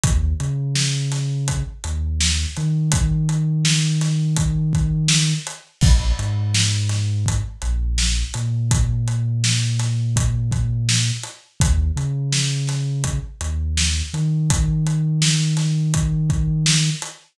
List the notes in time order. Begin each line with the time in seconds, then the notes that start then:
0.03 D#2, kick, closed hi-hat
0.40 C#3, closed hi-hat
0.75 snare
1.12 snare, closed hi-hat
1.48 kick, closed hi-hat
1.84 D#2, closed hi-hat
2.20 snare
2.57 D#3, closed hi-hat
2.92 kick, closed hi-hat
3.29 closed hi-hat
3.65 snare
4.01 snare, closed hi-hat
4.36 kick, closed hi-hat
4.73 kick, closed hi-hat
5.08 snare
5.47 closed hi-hat
5.81 A#1, kick, crash
6.19 G#2, closed hi-hat
6.54 snare
6.89 snare, closed hi-hat
7.26 kick, closed hi-hat
7.62 A#1, closed hi-hat
7.98 snare
8.34 A#2, closed hi-hat
8.71 kick, closed hi-hat
9.08 closed hi-hat
9.44 snare
9.79 snare, closed hi-hat
10.16 kick, closed hi-hat
10.52 kick, closed hi-hat
10.89 snare
11.23 closed hi-hat
11.60 D#2, kick, closed hi-hat
11.96 C#3, closed hi-hat
12.33 snare
12.67 snare, closed hi-hat
13.04 kick, closed hi-hat
13.41 D#2, closed hi-hat
13.77 snare
14.14 D#3, closed hi-hat
14.50 kick, closed hi-hat
14.87 closed hi-hat
15.22 snare
15.57 snare, closed hi-hat
15.94 kick, closed hi-hat
16.30 kick, closed hi-hat
16.66 snare
17.02 closed hi-hat